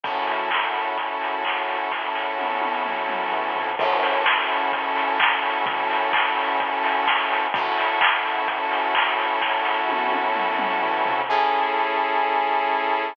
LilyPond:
<<
  \new Staff \with { instrumentName = "Lead 2 (sawtooth)" } { \time 4/4 \key fis \minor \tempo 4 = 128 <cis' e' fis' a'>1~ | <cis' e' fis' a'>1 | <cis' e' fis' a'>1~ | <cis' e' fis' a'>1 |
<cis' e' fis' a'>1~ | <cis' e' fis' a'>1 | \key a \major <cis' e' gis' a'>1 | }
  \new Staff \with { instrumentName = "Synth Bass 1" } { \clef bass \time 4/4 \key fis \minor fis,1 | fis,2. e,8 eis,8 | fis,1 | fis,1 |
fis,1 | fis,2. e,8 eis,8 | \key a \major a,,2 a,,2 | }
  \new DrumStaff \with { instrumentName = "Drums" } \drummode { \time 4/4 <hh bd>8 hho8 <hc bd>8 hho8 <hh bd>8 hho8 <hc bd>8 hho8 | <bd sn>8 sn8 tommh8 tommh8 toml8 toml8 tomfh8 tomfh8 | <cymc bd>8 hho8 <bd sn>8 hho8 <hh bd>8 hho8 <hc bd>8 hho8 | <hh bd>8 hho8 <hc bd>8 hho8 <hh bd>8 hho8 <bd sn>8 hho8 |
<hh bd>8 hho8 <hc bd>8 hho8 <hh bd>8 hho8 <hc bd>8 hho8 | <bd sn>8 sn8 tommh8 tommh8 toml8 toml8 tomfh8 tomfh8 | r4 r4 r4 r4 | }
>>